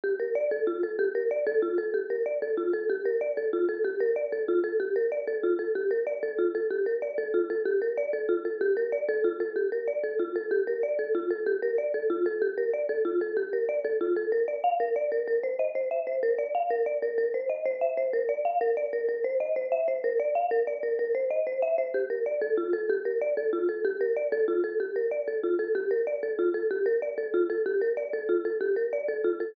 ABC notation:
X:1
M:6/8
L:1/8
Q:3/8=126
K:Gm
V:1 name="Marimba"
G B d A F A | G B d A F A | G B d A F A | G B d A F A |
G B d A F A | G B d A F A | G B d A F A | G B d A F A |
G B d A F A | G B d A F A | G B d A F A | G B d A F A |
G B d A F A | G B d A F A | G B d A F A | B d f B d B |
B c e c =e c | B d f B d B | B c e c =e c | B d f B d B |
B c e c =e c | B d f B d B | B c e c =e c | G B d A F A |
G B d A F A | G B d A F A | G B d A F A | G B d A F A |
G B d A F A | G B d A F A | G B d A F A |]